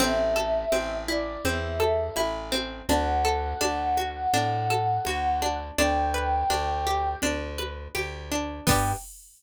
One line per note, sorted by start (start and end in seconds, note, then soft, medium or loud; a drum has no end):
0.00 0.65 A1 loud
0.00 0.72 C4 loud
0.00 0.97 E5 medium
0.00 low conga loud
0.36 1.79 A4 loud
0.36 high conga medium
0.72 1.37 A1 medium
0.72 1.45 C4 medium
0.72 high conga medium
1.08 2.16 E4 medium
1.08 1.41 D5 medium
1.45 2.10 E2 medium
1.45 2.52 C4 medium
1.45 1.77 E5 medium
1.45 low conga medium
1.80 2.83 A4 medium
1.80 2.14 E5 medium
1.80 high conga medium
2.16 2.82 A1 medium
2.16 2.85 E4 loud
2.16 high conga medium
2.52 2.86 C4 medium
2.52 high conga medium
2.89 3.54 D2 loud
2.89 3.60 D4 loud
2.89 5.57 F#5 medium
2.89 low conga medium
3.25 4.70 A4 loud
3.61 4.27 D2 medium
3.61 4.33 D4 loud
3.61 high conga medium
3.97 5.06 F#4 medium
3.97 high conga medium
4.33 4.98 A2 medium
4.33 5.42 D4 loud
4.33 low conga medium
4.70 5.73 A4 medium
4.70 high conga medium
5.05 5.71 D2 medium
5.05 5.75 F#4 medium
5.05 high conga medium
5.42 5.76 D4 medium
5.42 high conga medium
5.78 6.44 D2 loud
5.78 6.49 D4 loud
5.78 7.16 G5 medium
5.78 low conga medium
6.14 7.58 B4 medium
6.50 7.15 D2 medium
6.50 7.22 D4 medium
6.50 high conga medium
6.87 7.94 G4 medium
7.22 7.88 D2 medium
7.22 8.31 D4 loud
7.22 low conga medium
7.58 8.61 B4 medium
7.58 high conga medium
7.95 8.60 D2 medium
7.95 8.64 G4 medium
7.95 high conga medium
8.31 8.66 D4 medium
8.66 8.93 G2 loud
8.66 8.92 B3 loud
8.66 8.92 D4 loud
8.66 8.92 G5 loud
8.66 kick loud
8.66 crash loud
8.71 8.92 G4 loud